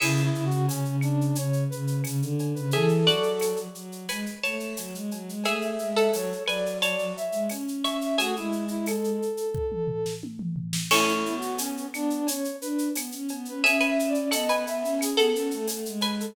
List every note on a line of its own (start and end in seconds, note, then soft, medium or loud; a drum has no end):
0.00 0.29 C#3 medium
0.00 0.21 E4 medium
0.00 2.53 G#4 medium
0.00 2.53 E5 medium
0.00 crash loud
0.00 cowbell loud
0.00 claves loud
0.17 shaker medium
0.23 0.45 E4 medium
0.35 0.50 C#3 medium
0.35 shaker medium
0.45 0.66 F#4 medium
0.51 0.67 C#3 medium
0.51 shaker medium
0.67 0.83 C#3 medium
0.67 0.96 C#4 medium
0.67 tambourine medium
0.67 cowbell medium
0.67 shaker loud
0.85 1.31 C#3 medium
0.85 shaker medium
1.01 1.36 D4 medium
1.01 claves loud
1.01 shaker medium
1.21 shaker medium
1.35 1.64 C#3 medium
1.35 1.64 C#5 medium
1.35 cowbell medium
1.35 shaker loud
1.53 shaker medium
1.69 2.01 C#3 medium
1.69 2.01 B4 medium
1.69 shaker medium
1.87 shaker medium
2.04 2.20 C#3 medium
2.04 tambourine medium
2.04 cowbell medium
2.04 claves medium
2.04 shaker loud
2.21 2.53 D3 medium
2.21 shaker medium
2.39 cowbell medium
2.39 shaker medium
2.55 2.72 C#3 medium
2.55 2.71 B4 medium
2.55 shaker medium
2.71 3.04 E3 medium
2.71 3.06 G#4 medium
2.71 3.58 A4 medium
2.71 3.06 E5 medium
2.71 cowbell loud
2.71 shaker medium
2.88 shaker medium
3.07 3.65 F#3 medium
3.07 3.71 F#4 medium
3.07 3.71 D5 medium
3.07 shaker medium
3.23 shaker medium
3.39 tambourine medium
3.39 cowbell medium
3.39 claves medium
3.39 shaker loud
3.57 shaker medium
3.75 4.05 F#3 medium
3.75 shaker medium
3.92 shaker medium
4.09 4.25 G#3 medium
4.09 4.37 B4 medium
4.09 4.37 G#5 medium
4.09 cowbell medium
4.09 claves medium
4.09 shaker loud
4.26 shaker medium
4.43 4.74 A3 medium
4.43 4.98 C#5 medium
4.43 4.98 A5 medium
4.43 shaker medium
4.60 shaker medium
4.77 4.94 F#3 medium
4.77 tambourine medium
4.77 cowbell medium
4.77 shaker loud
4.94 5.10 G#3 medium
4.94 shaker medium
5.11 5.28 F#3 medium
5.11 cowbell medium
5.11 shaker medium
5.27 5.43 G#3 medium
5.27 shaker medium
5.44 5.76 A3 medium
5.44 5.94 G#4 medium
5.44 5.94 E5 medium
5.44 5.67 E5 medium
5.44 cowbell medium
5.44 claves medium
5.44 shaker medium
5.61 shaker medium
5.70 5.90 E5 medium
5.79 6.08 G#3 medium
5.79 shaker medium
5.90 6.12 E5 medium
5.96 6.39 A4 medium
5.96 6.39 F#5 medium
5.96 shaker medium
6.13 6.30 F#3 medium
6.13 6.43 C#5 medium
6.13 tambourine medium
6.13 cowbell medium
6.13 shaker loud
6.32 shaker medium
6.46 7.16 F#3 medium
6.46 6.80 B4 medium
6.46 6.77 D5 medium
6.46 6.80 G#5 medium
6.46 claves medium
6.46 shaker medium
6.66 shaker medium
6.81 7.15 C#5 medium
6.81 7.12 D5 medium
6.81 7.15 A5 medium
6.81 cowbell medium
6.81 shaker loud
6.99 shaker medium
7.17 7.48 E5 medium
7.17 shaker medium
7.31 7.48 G#3 medium
7.31 shaker medium
7.49 7.83 C#4 medium
7.49 tambourine medium
7.49 cowbell medium
7.49 claves medium
7.49 shaker medium
7.68 shaker medium
7.84 8.16 C#4 medium
7.84 8.16 E5 medium
7.84 8.16 C#6 medium
7.84 cowbell medium
7.84 shaker medium
8.01 8.18 E5 medium
8.01 shaker medium
8.18 8.35 A3 medium
8.18 8.35 F#4 medium
8.18 9.17 G#4 medium
8.18 9.17 E5 medium
8.18 cowbell loud
8.18 shaker loud
8.36 9.19 G#3 medium
8.36 8.64 E4 medium
8.36 shaker medium
8.52 shaker medium
8.68 8.86 E4 medium
8.68 shaker medium
8.86 10.13 A4 medium
8.86 tambourine medium
8.86 cowbell medium
8.86 claves loud
8.86 shaker loud
9.04 shaker medium
9.22 shaker medium
9.37 shaker medium
9.55 kick loud
9.72 mid tom medium
9.87 floor tom medium
10.06 snare medium
10.23 high tom medium
10.39 mid tom loud
10.56 floor tom medium
10.73 snare loud
10.90 11.23 A3 loud
10.90 13.11 C#4 medium
10.90 11.12 E4 medium
10.90 13.11 A4 medium
10.90 crash loud
10.90 cowbell loud
10.90 claves loud
11.09 shaker medium
11.14 11.35 E4 medium
11.25 11.86 B3 medium
11.25 shaker medium
11.37 11.59 F#4 medium
11.42 shaker medium
11.58 11.86 C#4 medium
11.58 tambourine medium
11.58 cowbell loud
11.58 shaker loud
11.77 shaker medium
11.92 12.20 B3 medium
11.92 12.27 D4 medium
11.92 claves loud
11.92 shaker medium
12.10 shaker medium
12.27 12.44 C#4 medium
12.27 12.56 C#5 medium
12.27 cowbell medium
12.27 shaker loud
12.44 shaker medium
12.61 12.88 D4 medium
12.61 12.89 B4 medium
12.61 shaker medium
12.78 shaker medium
12.95 13.11 B3 medium
12.95 tambourine loud
12.95 cowbell medium
12.95 claves loud
12.95 shaker loud
13.12 13.28 C#4 medium
13.12 shaker medium
13.28 13.47 B3 medium
13.28 cowbell medium
13.28 shaker medium
13.45 13.62 C#4 medium
13.45 13.64 B4 medium
13.45 shaker medium
13.62 14.27 C#4 loud
13.62 13.80 G#4 medium
13.62 13.85 E5 medium
13.62 13.80 E5 loud
13.62 cowbell loud
13.62 shaker loud
13.80 14.10 B4 medium
13.80 14.10 G#5 medium
13.80 shaker medium
13.87 14.09 E5 medium
13.99 shaker loud
14.08 14.30 D5 medium
14.14 shaker medium
14.31 14.48 B3 medium
14.31 14.48 A4 medium
14.31 14.63 D#5 medium
14.31 14.48 F#5 medium
14.31 tambourine medium
14.31 cowbell medium
14.31 claves loud
14.31 shaker loud
14.48 14.66 B3 medium
14.48 15.14 B4 medium
14.48 15.14 G#5 medium
14.48 shaker medium
14.67 14.83 B3 medium
14.67 14.99 E5 medium
14.67 shaker medium
14.83 15.12 C#4 medium
14.83 shaker medium
14.99 15.29 G#4 medium
14.99 cowbell medium
14.99 claves loud
14.99 shaker loud
15.17 15.33 B3 loud
15.17 15.92 A4 medium
15.17 15.92 F#5 medium
15.17 shaker medium
15.34 15.50 C#4 medium
15.34 15.67 A4 medium
15.34 shaker medium
15.51 15.68 A3 medium
15.51 shaker medium
15.67 15.85 A3 medium
15.67 tambourine medium
15.67 cowbell medium
15.67 shaker loud
15.86 16.28 G#3 medium
15.86 shaker medium
16.01 16.31 B4 medium
16.01 16.31 G#5 medium
16.01 cowbell medium
16.01 shaker medium
16.20 16.35 A4 medium
16.20 shaker medium